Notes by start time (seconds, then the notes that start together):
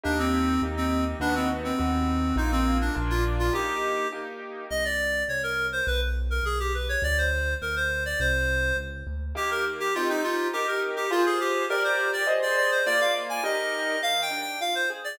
0.04 D#2 A#3 D4 D#4 G4
0.19 C4
0.62 D#2 A#3 D#4 G4
0.77 C4
1.20 D#2 B3 D4 D#4 F#4
1.35 C4
1.64 C4
1.78 D#2 B3 D#4 F#4
2.36 A#1 A#3 D#4 F4
2.52 C4
2.81 D4
2.95 A#1 A#3 D4 F4
3.10 F4
3.39 F4
3.53 A#3 D#4 G4
4.12 A#3 D#4 G4
4.70 C2 D#5
4.85 D5
5.28 C2 C#5
5.43 A#4
5.72 C5
5.87 B1 B4
6.30 A#4
6.43 B1 G#4
6.60 G4
6.74 B4
6.89 C#5
7.02 D2 D5
7.18 C5
7.62 D2 A#4
7.76 C5
8.05 D5
8.19 C2 C5
8.77 C#2
9.07 D2
9.35 D#3 A#3 G4
9.51 A#4
9.80 G4
9.95 C4 D#4 F4 G4
10.09 D#4
10.24 F4
10.53 D#4 G4 A#4
10.67 A#4
10.96 G4
11.11 F4 G#4 C5
11.26 G#4
11.40 G4
11.69 G4 A#4 D5
11.84 C5
12.13 D5
12.27 G#4 C5 D#5
12.42 D5
12.57 D5
12.71 C5
12.86 A#3 F4 D5
13.00 F5
13.29 G#5
13.43 D#4 G4 A#4 D#5
14.02 D#3 F5
14.22 G5
14.30 D4
14.41 G5
14.61 F4 F5
14.75 C5
14.90 G#4
15.04 D5